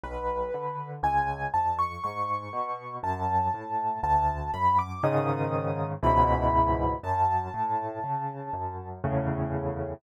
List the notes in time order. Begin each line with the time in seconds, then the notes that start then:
0.03 B1 B4
0.54 D3
1.03 C#2 G#5
1.54 F2 A5
1.79 C#6
2.04 G#2 C#6
2.53 B2
3.03 F#2 A5
3.54 A2
4.03 D2 A5
4.54 F#2 B5
4.79 D6
5.03 G#2 C#3 D#3 D#6
6.03 C#2 G#2 B2 E3 B5
7.03 F#2 A5
7.54 A2
8.04 C#3
8.53 F#2
9.04 E2 A2 C#3